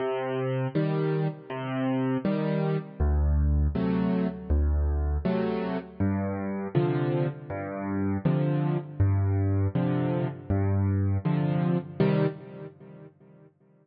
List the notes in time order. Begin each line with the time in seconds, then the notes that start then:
0.00 C3
0.75 D#3 G3
1.50 C3
2.25 D#3 G3
3.00 D2
3.75 C3 F#3 A3
4.50 D2
5.25 C3 F#3 A3
6.00 G2
6.75 C3 D3 F3
7.50 G2
8.25 C3 D3 F3
9.00 G2
9.75 C3 D3 F3
10.50 G2
11.25 C3 D3 F3
12.00 C3 D#3 G3